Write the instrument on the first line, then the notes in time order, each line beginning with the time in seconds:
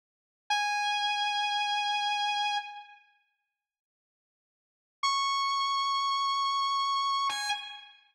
distortion guitar
0.50 G#5
5.03 C#6
7.29 G#5